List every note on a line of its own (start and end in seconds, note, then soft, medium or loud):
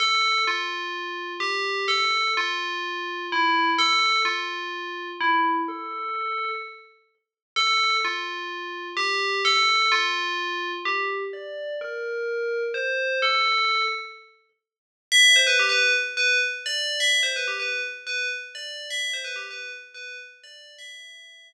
0.00 0.42 A4 loud
0.47 1.33 F4 loud
1.40 1.86 G4 medium
1.88 2.31 A4 loud
2.37 3.26 F4 loud
3.32 3.70 E4 medium
3.78 4.20 A4 loud
4.25 5.08 F4 medium
5.20 5.61 E4 loud
5.68 6.48 A4 loud
7.56 7.96 A4 loud
8.05 8.88 F4 medium
8.97 9.41 G4 loud
9.45 9.91 A4 loud
9.92 10.71 F4 loud
10.85 11.24 G4 loud
11.33 11.73 D5 loud
11.81 12.61 A#4 loud
12.74 13.19 C5 medium
13.22 13.83 A4 loud
15.12 15.35 E5 loud
15.36 15.47 C5 medium
15.47 15.58 B4 loud
15.59 15.71 G4 loud
15.69 15.92 B4 loud
16.17 16.38 B4 loud
16.66 16.99 D5 loud
17.00 17.20 E5 loud
17.23 17.34 C5 loud
17.36 17.47 B4 medium
17.48 17.59 G4 medium
17.59 17.81 B4 medium
18.07 18.28 B4 loud
18.55 18.88 D5 loud
18.90 19.13 E5 loud
19.13 19.25 C5 loud
19.24 19.36 B4 loud
19.36 19.47 G4 medium
19.51 19.71 B4 medium
19.94 20.17 B4 loud
20.44 20.74 D5 loud
20.78 21.46 E5 loud